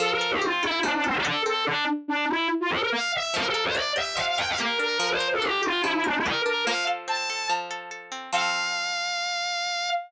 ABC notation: X:1
M:4/4
L:1/16
Q:1/4=144
K:F
V:1 name="Violin"
A B2 G F2 E2 D D C D A2 A2 | D2 z2 D2 E2 z F A B f2 e2 | B A2 c d2 e2 f f g f B2 B2 | B c2 A G2 F2 E E D E B2 B2 |
f2 z2 a4 z8 | f16 |]
V:2 name="Acoustic Guitar (steel)"
F,2 A2 C2 A2 F,2 A2 A2 C2 | z16 | F,2 B2 D2 G2 F,2 B2 G2 D2 | F,2 B2 D2 G2 F,2 B2 G2 D2 |
F,2 A2 C2 A2 F,2 A2 A2 C2 | [F,CA]16 |]